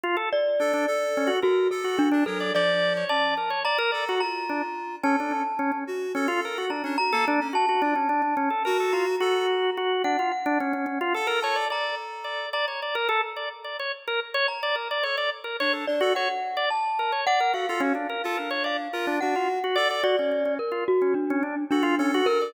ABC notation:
X:1
M:9/8
L:1/16
Q:3/8=72
K:none
V:1 name="Drawbar Organ"
F A z2 D D z2 _D _G _B2 z G G =D B d | d3 _d =d2 _B _d =d B d _G z2 D z3 | _D =D _D z D D z2 D F _B _G =D _D z A =D z | _G G D _D =D D _D A _B A F z G4 G2 |
D F z D _D D D F A _B _d =d d2 z2 d2 | d _d =d _B A z d z d _d z B z d z =d B d | _d =d z _B _d A z _G d z2 =d z2 B _d =d B | _G F _D =D _B A B _d =d z B D D F z G d d |
_G _D D D z F z D z D =D z G F _D G _B =d |]
V:2 name="Glockenspiel"
z2 d8 _G2 A2 D2 A2 | d4 a4 _b4 b6 | a6 z6 _b2 b4 | a10 _b8 |
_g2 g8 a2 _b6 | _b10 z4 b4 | z6 d2 _g4 a4 g2 | f8 f4 _g6 |
d4 _B2 _G2 D4 D4 B2 |]
V:3 name="Clarinet"
z4 A2 A4 A2 A3 D _G,2 | F,4 _D2 z4 A2 F6 | A3 z3 _G2 A4 z D G _B, z _D | z2 F z5 _G4 A2 z4 |
z8 A4 A6 | z18 | A2 z2 D2 D A _G z9 | A A _G z2 F D4 F2 G3 z A2 |
z12 A2 A4 |]